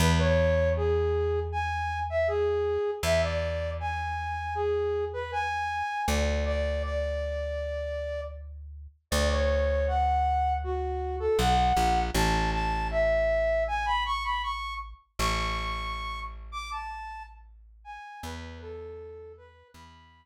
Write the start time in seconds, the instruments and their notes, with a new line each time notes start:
0.00 electric bass (finger) E2, flute B4
0.18 flute C#5
0.76 flute G#4
1.52 flute G#5
2.10 flute E5
2.28 flute G#4
3.03 electric bass (finger) E2, flute E5
3.23 flute D5
3.80 flute G#5
4.55 flute G#4
5.13 flute B4
5.32 flute G#5
6.08 electric bass (finger) D2, flute D5
6.46 flute D5
6.83 flute D5
9.11 electric bass (finger) D2, flute D5
9.31 flute C#5
9.87 flute F#5
10.64 flute F#4
11.20 flute A4
11.39 electric bass (finger) B1, flute F#5
11.77 electric bass (finger) A#1
12.15 electric bass (finger) A1, flute A5
12.53 flute A5
12.91 flute E5
13.68 flute G#5
13.86 flute B5
14.06 flute C#6
14.24 flute B5
14.43 flute C#6
15.19 electric bass (finger) A1, flute C#6
16.52 flute D6
16.71 flute A5
17.84 flute G#5
18.23 electric bass (finger) E2, flute B4
18.61 flute A4
19.37 flute B4
19.74 electric bass (finger) E2, flute B5